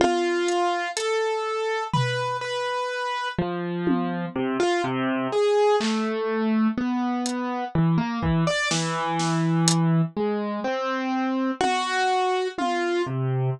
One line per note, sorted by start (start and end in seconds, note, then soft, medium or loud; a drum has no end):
0.00 0.88 F4 loud
0.00 high tom medium
0.48 closed hi-hat medium
0.96 1.83 A4 medium
0.96 closed hi-hat medium
1.93 2.37 B4 medium
1.93 floor tom medium
2.41 3.28 B4 medium
3.38 4.25 F3 medium
3.87 high tom loud
4.35 4.57 C3 medium
4.60 4.81 F4 loud
4.84 5.27 C3 loud
5.32 5.76 G#4 medium
5.80 6.67 A3 medium
5.80 clap medium
6.77 7.65 B3 medium
7.26 closed hi-hat medium
7.75 7.97 E3 medium
7.98 8.19 A#3 medium
8.22 8.44 E3 medium
8.22 kick medium
8.47 8.69 D5 medium
8.71 10.01 E3 medium
8.71 snare medium
9.19 snare medium
9.68 closed hi-hat loud
10.16 10.60 G#3 medium
10.64 11.51 C4 medium
11.60 12.48 F#4 loud
11.60 high tom medium
12.58 13.02 F4 medium
12.58 high tom medium
13.06 13.50 C3 soft